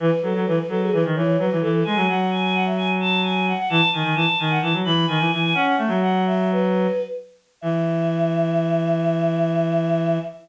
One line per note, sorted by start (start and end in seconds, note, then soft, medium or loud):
0.00 0.10 E3 loud
0.00 0.20 B4 loud
0.22 0.33 F#3 loud
0.22 0.45 A4 medium
0.35 0.46 F#3 loud
0.46 0.59 E3 loud
0.46 0.57 B4 loud
0.58 0.69 B4 medium
0.69 0.90 F#3 loud
0.69 0.80 A4 loud
0.81 0.92 G#4 loud
0.92 1.04 E3 loud
0.92 1.03 B4 loud
1.05 1.15 D#3 loud
1.15 1.37 E3 loud
1.15 1.36 C#5 medium
1.38 1.50 F#3 loud
1.38 1.58 B4 loud
1.52 1.62 E3 loud
1.62 1.83 E3 loud
1.62 1.72 A4 loud
1.73 1.84 A4 loud
1.85 1.97 G#3 loud
1.85 2.06 G#5 medium
1.95 2.06 F#3 loud
2.08 3.53 F#3 loud
2.08 2.29 F#5 medium
2.31 2.42 G#5 medium
2.42 2.53 G#5 loud
2.54 2.65 F#5 medium
2.65 2.76 E5 medium
2.77 2.88 G#5 loud
3.00 3.20 A5 loud
3.23 3.44 G#5 medium
3.46 3.57 F#5 medium
3.58 3.69 F#5 medium
3.69 3.81 E3 loud
3.69 3.88 A5 loud
3.92 4.03 D#3 loud
3.92 4.14 G#5 medium
4.03 4.14 D#3 loud
4.15 4.26 E3 loud
4.15 4.26 A5 loud
4.27 4.38 A5 medium
4.39 4.59 D#3 loud
4.39 4.50 G#5 medium
4.50 4.61 F#5 medium
4.61 4.73 E3 loud
4.61 4.72 A5 medium
4.73 4.84 F#3 loud
4.84 5.06 E3 loud
4.84 5.05 B5 medium
5.07 5.19 D#3 loud
5.07 5.29 G#5 loud
5.20 5.31 E3 loud
5.31 5.54 E3 loud
5.31 5.42 G#5 loud
5.42 5.53 G#5 loud
5.54 5.75 C#4 loud
5.54 5.65 F#5 loud
5.66 5.77 F#5 medium
5.77 5.89 A3 loud
5.77 5.99 E5 medium
5.88 6.87 F#3 loud
6.01 6.24 F#5 medium
6.26 6.49 E5 loud
6.52 7.03 B4 loud
7.61 10.18 E3 loud
7.61 10.17 E5 loud